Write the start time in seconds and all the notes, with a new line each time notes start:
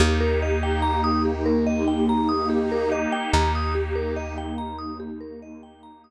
0.00 D#2 A#3 D#4 G4
0.20 A#4
0.42 D#5
0.63 G5
0.82 A#5
1.04 D#6
1.25 G4
1.46 A#4
1.67 D#5
1.88 G5
2.09 A#5
2.29 D#6
2.50 G4
2.72 A#4
2.92 D#5
3.12 G5
3.33 D#2 G4 A#5
3.55 D#6
3.75 G4
3.95 A#4
4.16 D#5
4.38 G5
4.58 A#5
4.78 D#6
5.00 G4
5.20 A#4
5.42 D#5
5.63 G5
5.83 A#5
6.04 D#6